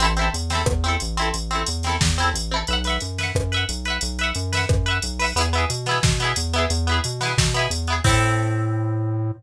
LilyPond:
<<
  \new Staff \with { instrumentName = "Overdriven Guitar" } { \time 4/4 \key a \minor \tempo 4 = 179 <c' e' a'>8 <c' e' a'>4 <c' e' a'>4 <c' e' a'>4 <c' e' a'>8~ | <c' e' a'>8 <c' e' a'>4 <c' e' a'>4 <c' e' a'>4 <c' e' a'>8 | <b' e'' fis''>8 <b' e'' fis''>4 <b' e'' fis''>4 <b' e'' fis''>4 <b' e'' fis''>8~ | <b' e'' fis''>8 <b' e'' fis''>4 <b' e'' fis''>4 <b' e'' fis''>4 <b' e'' fis''>8 |
<b e' gis'>8 <b e' gis'>4 <b e' gis'>4 <b e' gis'>4 <b e' gis'>8~ | <b e' gis'>8 <b e' gis'>4 <b e' gis'>4 <b e' gis'>4 <b e' gis'>8 | <c' e' a'>1 | }
  \new Staff \with { instrumentName = "Synth Bass 1" } { \clef bass \time 4/4 \key a \minor a,,4 e,4 e,4 a,,4 | a,,4 e,4 e,4 a,,4 | b,,4 fis,4 fis,4 b,,4 | b,,4 fis,4 fis,4 b,,4 |
e,4 b,4 b,4 e,4 | e,4 b,4 b,4 e,4 | a,1 | }
  \new DrumStaff \with { instrumentName = "Drums" } \drummode { \time 4/4 hh8 hh8 hh8 <hh sn>8 <bd ss>8 hh8 hh8 hh8 | hh8 hh8 hh8 <hh sn>8 <bd sn>8 hh8 hh4 | hh8 <hh sn>8 hh8 <hh sn>8 <bd ss>8 hh8 hh8 hh8 | hh8 hh8 hh8 <hh sn>8 <bd ss>8 hh8 hh8 hho8 |
hh8 hh8 hh8 <hh sn>8 <bd sn>8 hh8 hh8 hh8 | hh8 hh8 hh8 <hh sn>8 <bd sn>8 hh8 hh8 hh8 | <cymc bd>4 r4 r4 r4 | }
>>